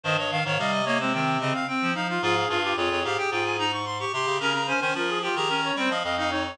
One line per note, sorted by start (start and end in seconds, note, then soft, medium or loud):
0.04 0.40 G2 medium
0.04 0.17 D#3 medium
0.04 0.16 C5 loud
0.04 0.17 D#5 medium
0.18 0.31 C#5 medium
0.18 0.30 D#5 medium
0.31 0.44 D#3 medium
0.31 0.44 F5 medium
0.31 0.42 F5 medium
0.43 0.58 G#2 medium
0.43 0.58 D#3 medium
0.43 0.59 C#5 loud
0.43 0.56 F5 medium
0.59 1.53 C3 medium
0.59 0.82 G3 medium
0.59 0.85 D#5 medium
0.59 0.72 F5 loud
0.72 0.85 D#5 medium
0.84 0.99 A#3 medium
0.84 0.97 C#5 medium
0.84 0.99 D#5 loud
0.99 1.13 G#3 medium
0.99 1.13 C4 medium
0.99 1.12 C5 medium
1.13 1.37 D#3 medium
1.13 1.39 C4 medium
1.13 1.37 G5 medium
1.40 1.53 C#3 medium
1.40 1.65 C4 medium
1.40 1.53 D#5 loud
1.54 1.67 F5 loud
1.68 1.91 C4 medium
1.68 1.93 G5 loud
1.81 1.94 F3 medium
1.94 2.19 F3 medium
1.94 2.07 D#4 medium
1.94 2.08 F5 loud
2.09 2.23 F4 medium
2.09 2.22 F5 medium
2.22 2.46 G#2 loud
2.22 2.35 F4 medium
2.22 2.59 G#4 medium
2.22 2.48 F5 loud
2.49 2.74 G2 loud
2.49 2.62 F4 medium
2.49 2.73 F5 medium
2.63 2.76 F4 medium
2.63 2.76 G4 medium
2.75 2.90 F2 medium
2.75 3.00 F4 medium
2.75 3.65 G#4 medium
2.75 2.90 C#5 medium
2.91 3.04 F2 medium
2.91 3.04 C#5 medium
3.04 3.17 G#2 medium
3.04 3.17 G4 medium
3.04 3.18 F5 medium
3.17 3.30 G4 medium
3.17 3.30 G5 loud
3.31 4.05 G#2 medium
3.31 3.57 F4 medium
3.31 3.44 G5 loud
3.44 3.58 G#5 medium
3.59 3.72 D#4 medium
3.59 3.72 A#5 loud
3.72 3.85 C#6 medium
3.85 3.98 C6 medium
4.00 4.12 G4 medium
4.00 4.13 C#6 medium
4.13 4.26 C3 medium
4.13 4.38 G4 medium
4.13 4.37 C6 loud
4.27 4.40 C#3 medium
4.40 4.73 C#3 medium
4.40 4.53 C#4 medium
4.40 4.63 A#4 medium
4.40 4.53 A#5 loud
4.54 4.67 A#5 loud
4.67 4.81 C#4 medium
4.67 4.79 C5 medium
4.67 4.80 G#5 loud
4.80 4.95 D#3 medium
4.80 4.94 C#4 medium
4.80 4.93 C5 medium
4.80 4.94 G#5 medium
4.95 5.29 F3 medium
4.95 5.19 F4 medium
4.95 5.10 A#4 medium
5.08 5.21 G#4 medium
5.22 5.37 F4 medium
5.22 5.35 G4 medium
5.22 5.35 G5 medium
5.35 5.71 D#3 medium
5.35 5.49 G4 medium
5.35 5.48 G#4 medium
5.35 5.74 A#5 loud
5.48 5.73 C#4 medium
5.48 5.61 A#4 medium
5.64 5.76 C#5 medium
5.76 5.89 G3 medium
5.76 5.90 C4 medium
5.76 5.91 C5 medium
5.76 5.90 G5 medium
5.89 6.03 F3 medium
5.89 6.02 D#5 medium
5.89 6.03 F5 medium
6.04 6.56 F2 medium
6.04 6.16 D#5 medium
6.04 6.17 F5 loud
6.16 6.30 D#4 medium
6.16 6.29 D#5 medium
6.16 6.31 F5 medium
6.30 6.55 D#4 medium
6.30 6.43 C#5 medium
6.45 6.58 C#5 medium